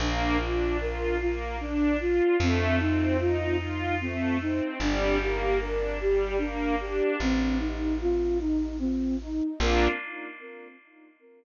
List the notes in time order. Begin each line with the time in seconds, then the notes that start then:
0.00 A#1 A#3 D4
0.40 D4 F4
0.80 F4 A#4
1.20 A#3 F4
1.61 D4
1.99 F4
2.39 F2 A3 C4
2.79 C4 D#4
3.19 D#4 F4
3.58 D#4 F4
4.01 A3 C4
4.41 C4 D#4
4.80 G1 G3 D4
5.19 A#3 G4
5.61 D4 A#4
6.00 G3 G4
6.38 A#3 D4
6.80 D4 G4
7.20 A1 C4
7.59 D#4
8.01 F4
8.40 D#4
8.79 C4
9.22 D#4
9.60 A#1 A#3 D4 F4 A#4